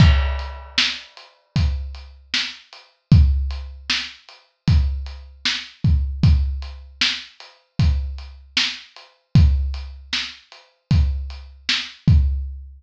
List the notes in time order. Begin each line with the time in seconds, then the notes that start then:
0.00 kick, crash
0.39 closed hi-hat
0.78 snare
1.17 closed hi-hat
1.56 kick, closed hi-hat
1.94 closed hi-hat
2.34 snare
2.73 closed hi-hat
3.12 kick, closed hi-hat
3.50 closed hi-hat
3.90 snare
4.29 closed hi-hat
4.68 kick, closed hi-hat
5.06 closed hi-hat
5.45 snare
5.84 kick, closed hi-hat
6.23 kick, closed hi-hat
6.62 closed hi-hat
7.01 snare
7.40 closed hi-hat
7.79 kick, closed hi-hat
8.18 closed hi-hat
8.57 snare
8.96 closed hi-hat
9.35 kick, closed hi-hat
9.74 closed hi-hat
10.13 snare
10.52 closed hi-hat
10.91 kick, closed hi-hat
11.30 closed hi-hat
11.69 snare
12.08 kick, closed hi-hat